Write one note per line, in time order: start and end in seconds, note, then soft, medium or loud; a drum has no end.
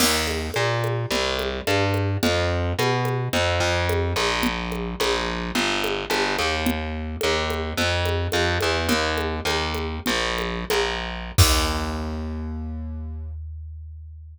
0.00 0.50 D#2 medium
0.00 crash loud
0.00 low conga medium
0.27 high conga medium
0.54 1.06 A#2 medium
0.54 high conga medium
0.84 high conga medium
1.11 1.61 C2 medium
1.11 low conga medium
1.39 high conga medium
1.67 2.17 G2 medium
1.67 high conga medium
1.94 high conga medium
2.23 2.73 F2 medium
2.23 low conga medium
2.79 3.29 B2 medium
2.79 high conga medium
3.05 high conga medium
3.33 3.59 F2 medium
3.33 low conga medium
3.60 4.13 F2 medium
3.89 high conga medium
4.16 4.95 A#1 medium
4.16 high conga medium
4.43 low conga medium
4.72 high conga medium
5.00 5.51 A#1 medium
5.00 high conga medium
5.55 6.05 G1 medium
5.55 low conga medium
5.84 high conga medium
6.10 6.36 G1 medium
6.10 high conga medium
6.38 7.16 D#2 medium
6.38 high conga medium
6.66 low conga loud
7.21 7.73 D#2 medium
7.21 high conga medium
7.50 high conga medium
7.77 8.27 F2 medium
7.77 low conga medium
8.05 high conga medium
8.32 8.58 F2 medium
8.32 high conga medium
8.61 8.87 E2 medium
8.61 high conga medium
8.89 9.40 D#2 medium
8.89 low conga medium
9.18 high conga medium
9.45 9.99 D#2 medium
9.45 high conga medium
9.74 high conga medium
10.06 10.65 A#1 medium
10.06 low conga medium
10.38 high conga medium
10.70 11.32 A#1 medium
10.70 high conga medium
11.38 14.37 D#2 loud
11.38 kick loud
11.38 crash loud